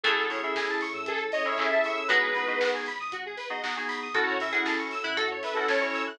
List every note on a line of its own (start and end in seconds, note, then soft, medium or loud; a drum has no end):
0.04 0.16 A1 loud
0.04 0.76 F#3 medium
0.04 0.76 A3 medium
0.04 1.06 C#4 medium
0.04 0.26 C#4 medium
0.04 1.06 E4 medium
0.04 0.26 E4 medium
0.04 0.15 G#4 medium
0.04 1.06 G#4 medium
0.04 0.26 G#4 medium
0.04 0.25 A4 loud
0.04 1.06 A4 medium
0.04 0.26 A4 medium
0.04 kick loud
0.04 closed hi-hat loud
0.17 0.40 A1 loud
0.17 0.28 A4 medium
0.29 0.40 C#4 medium
0.29 0.40 E4 medium
0.29 0.40 G#4 medium
0.29 0.40 A4 medium
0.29 0.41 C#5 medium
0.29 open hi-hat medium
0.43 0.85 C#4 medium
0.43 0.85 E4 medium
0.43 0.85 G#4 medium
0.43 0.85 A4 medium
0.43 0.55 E5 medium
0.55 0.68 G#5 medium
0.55 kick loud
0.55 snare loud
0.69 0.80 A5 medium
0.81 0.93 C#6 medium
0.81 open hi-hat medium
0.94 1.05 A2 medium
0.94 1.05 E6 medium
1.06 1.30 A1 loud
1.06 2.08 C#4 medium
1.06 2.08 E4 medium
1.06 1.19 G#4 loud
1.06 2.08 A4 medium
1.06 1.20 A4 loud
1.06 2.08 C#5 medium
1.06 kick loud
1.06 closed hi-hat loud
1.19 1.30 A4 medium
1.32 1.45 C#5 medium
1.32 1.45 D#5 loud
1.32 open hi-hat medium
1.45 1.55 C#4 medium
1.45 1.55 E4 medium
1.45 1.55 G#4 medium
1.45 1.55 A4 medium
1.45 1.58 C#5 loud
1.45 1.57 E5 medium
1.58 1.69 C#4 medium
1.58 1.69 E4 medium
1.58 1.69 G#4 medium
1.58 1.69 A4 medium
1.58 1.71 E5 medium
1.58 1.70 G#5 medium
1.58 kick loud
1.58 clap loud
1.70 2.01 C#4 medium
1.70 2.01 E4 medium
1.70 2.01 G#4 medium
1.70 2.01 A4 medium
1.70 1.96 E5 loud
1.70 1.83 A5 medium
1.84 1.97 C#6 medium
1.84 open hi-hat loud
1.96 2.08 E6 medium
2.08 2.21 G#1 loud
2.08 3.82 G#3 medium
2.08 2.30 B3 medium
2.08 3.82 B3 medium
2.08 2.30 D#4 medium
2.08 2.30 F#4 medium
2.08 2.21 F#4 medium
2.08 2.30 G#4 medium
2.08 2.70 B4 loud
2.08 kick loud
2.08 closed hi-hat loud
2.22 2.45 G#1 loud
2.22 2.33 G#4 medium
2.35 2.46 B3 medium
2.35 2.46 D#4 medium
2.35 2.46 F#4 medium
2.35 2.46 G#4 medium
2.35 2.47 B4 medium
2.35 open hi-hat medium
2.47 2.88 B3 medium
2.47 2.88 D#4 medium
2.47 2.88 F#4 medium
2.47 2.88 G#4 medium
2.47 2.59 D#5 medium
2.60 2.71 F#5 medium
2.60 kick loud
2.60 snare loud
2.73 2.85 G#5 medium
2.86 2.99 B5 medium
2.86 open hi-hat medium
2.99 3.11 G#1 medium
2.99 3.11 D#6 medium
3.12 3.35 G#1 loud
3.12 3.24 F#4 medium
3.12 kick loud
3.12 closed hi-hat loud
3.26 3.38 G#4 medium
3.37 3.48 B4 medium
3.37 open hi-hat medium
3.50 3.60 B3 medium
3.50 3.60 D#4 medium
3.50 3.60 F#4 medium
3.50 3.60 G#4 medium
3.50 3.62 D#5 medium
3.62 3.74 B3 medium
3.62 3.74 D#4 medium
3.62 3.74 F#4 medium
3.62 3.74 G#4 medium
3.62 3.74 F#5 medium
3.62 kick medium
3.62 snare loud
3.76 4.08 B3 medium
3.76 4.08 D#4 medium
3.76 4.08 F#4 medium
3.76 4.08 G#4 medium
3.76 3.88 G#5 medium
3.88 4.00 B5 medium
3.88 open hi-hat loud
4.02 4.14 D#6 medium
4.14 4.26 F#2 loud
4.14 4.35 C#4 medium
4.14 5.17 C#4 medium
4.14 4.35 E4 medium
4.14 5.17 E4 medium
4.14 4.35 F#4 medium
4.14 4.36 F#4 loud
4.14 5.17 F#4 medium
4.14 4.35 A4 medium
4.14 4.26 A4 medium
4.14 4.39 A4 medium
4.14 5.17 A4 medium
4.14 kick loud
4.14 closed hi-hat loud
4.27 4.50 F#2 medium
4.27 4.38 C#5 medium
4.40 4.51 C#4 medium
4.40 4.51 E4 medium
4.40 4.51 F#4 medium
4.40 4.51 A4 medium
4.40 4.52 E5 medium
4.40 open hi-hat loud
4.53 4.94 C#4 medium
4.53 4.94 E4 medium
4.53 4.94 F#4 medium
4.53 4.65 G#4 medium
4.53 4.94 A4 medium
4.53 4.65 F#5 medium
4.65 4.78 G#4 medium
4.65 4.76 A5 medium
4.65 kick medium
4.65 snare loud
4.78 4.90 C#6 medium
4.91 5.03 E6 medium
4.91 open hi-hat medium
5.03 5.16 F#2 medium
5.03 5.16 E4 medium
5.03 5.15 F#6 medium
5.16 5.40 F#2 medium
5.16 6.18 C#4 medium
5.16 6.18 E4 medium
5.16 5.29 F#4 loud
5.16 6.18 A4 medium
5.16 5.65 A4 medium
5.16 5.29 A4 medium
5.16 6.18 C#5 medium
5.16 kick loud
5.16 closed hi-hat loud
5.31 5.43 C#5 medium
5.42 5.56 B4 medium
5.42 5.54 E5 medium
5.42 open hi-hat loud
5.54 5.66 C#4 medium
5.54 5.66 E4 medium
5.54 5.66 F#4 medium
5.54 5.66 A4 loud
5.54 5.66 A4 medium
5.54 5.67 F#5 medium
5.68 5.80 C#4 medium
5.68 5.80 E4 medium
5.68 5.80 F#4 medium
5.68 5.80 A4 medium
5.68 5.81 C#5 loud
5.68 5.80 A5 medium
5.68 kick loud
5.68 snare loud
5.81 6.12 C#4 medium
5.81 6.12 E4 medium
5.81 6.12 F#4 medium
5.81 6.12 A4 medium
5.81 6.02 C#5 loud
5.81 5.92 C#6 medium
5.94 6.05 E6 medium
5.94 open hi-hat medium
6.07 6.18 F#6 medium